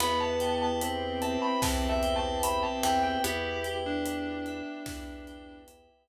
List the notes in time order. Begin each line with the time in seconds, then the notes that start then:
0.00 E2 B3 E4 G4 B4 B5, crash
0.20 A5
0.40 G5, closed hi-hat
0.62 A5
0.81 C4 B4, closed hi-hat
1.22 E5 A5, closed hi-hat
1.42 B5
1.62 E2 E3 B4 A5, kick, snare
1.89 E5
2.03 G5, closed hi-hat
2.16 A5
2.43 C4 E5 B5, closed hi-hat
2.63 A5
2.83 E2 E3 B4 G5, snare, closed hi-hat
3.03 G5
3.24 E2 B3 E4 G4 B4, closed hi-hat
3.64 G5, closed hi-hat
3.86 D4
4.05 B4, closed hi-hat
4.46 E5, closed hi-hat
4.86 E2 E3 B4, kick, snare
5.27 G5, closed hi-hat
5.68 E5, closed hi-hat
6.08 closed hi-hat